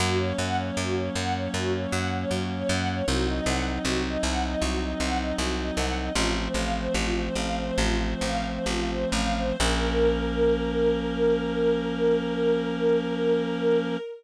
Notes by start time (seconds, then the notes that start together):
0.00 F#2 F#3 A#3 C#4 F#4
0.18 C#5
0.38 F#2 F#5
0.57 C#5
0.77 F#2 F#4
0.95 C#5
1.15 F#2 F#5
1.35 C#5
1.54 F#2 F#4
1.73 C#5
1.91 F#2 F#5
2.12 C#5
2.31 F#2 F#4
2.50 C#5
2.69 F#2 F#5
2.88 C#5
3.08 C2 F#3 C4 D#4 F#4
3.27 D#5
3.46 C2 F#5
3.66 D#5
3.85 C2 F#4
4.05 D#5
4.23 C2 F#5
4.42 D#5
4.60 C2 F#4
4.80 D#5
5.00 C2 F#5
5.18 D#5
5.38 C2 F#4
5.57 D#5
5.76 C2 F#5
5.97 D#5
6.15 A1 F3 A3 C4 F4
6.34 C5
6.54 A1 F5
6.74 C5
6.94 A1 F4
7.16 C5
7.35 A1 F5
7.55 C5
7.78 A1 F4
7.99 C5
8.21 A1 F5
8.44 C5
8.66 A1 F4
8.88 C5
9.12 A1 F5
9.35 C5
9.59 A#1 F3 A#3 C#4 A#4